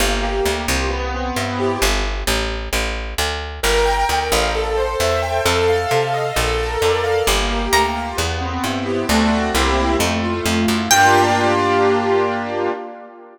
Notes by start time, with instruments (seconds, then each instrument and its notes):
0.00 electric bass (finger) G1, acoustic grand piano A#3
0.22 acoustic grand piano G4
0.45 electric bass (finger) D2, acoustic grand piano A#3
0.68 electric bass (finger) C2, acoustic grand piano F4
0.91 acoustic grand piano B3
1.14 acoustic grand piano C4
1.36 electric bass (finger) G2, acoustic grand piano E4
1.59 acoustic grand piano G4
1.82 electric bass (finger) G1
2.27 electric bass (finger) A1
2.73 electric bass (finger) A1
3.18 electric bass (finger) D2
3.63 electric bass (finger) G1, acoustic grand piano A#4
3.86 acoustic grand piano G5
4.09 electric bass (finger) D2, acoustic grand piano A#4
4.32 electric bass (finger) A1, acoustic grand piano F5
4.55 acoustic grand piano A4
4.77 acoustic grand piano C5
5.00 electric bass (finger) E2, acoustic grand piano E5
5.22 acoustic grand piano G5
5.45 electric bass (finger) F2, acoustic grand piano A4
5.68 acoustic grand piano F5
5.91 electric bass (finger) C3, acoustic grand piano A4
6.14 acoustic grand piano D#5
6.36 electric bass (finger) A#1, acoustic grand piano A4
6.58 acoustic grand piano A#4
6.82 electric bass (finger) F2, acoustic grand piano D5
7.04 acoustic grand piano F5
7.26 electric bass (finger) G1, acoustic grand piano A#3
7.50 acoustic grand piano G4
7.72 electric bass (finger) D2, acoustic grand piano A#3, acoustic guitar (steel) A#5
7.96 acoustic grand piano F4
8.17 electric bass (finger) E2, acoustic grand piano B3
8.41 acoustic grand piano C4
8.64 electric bass (finger) G2, acoustic grand piano E4
8.86 acoustic grand piano G4
9.09 electric bass (finger) D2, acoustic grand piano A3 C4 D4 F#4
9.54 electric bass (finger) C2, acoustic grand piano A#3 C4 E4 G4
9.99 electric bass (finger) F2, acoustic grand piano A3
10.23 acoustic grand piano F4
10.46 electric bass (finger) F2, acoustic grand piano A3
10.68 electric bass (finger) F#2, acoustic grand piano E4
10.91 electric bass (finger) G2, acoustic grand piano A#3 D4 F4 G4, acoustic guitar (steel) G5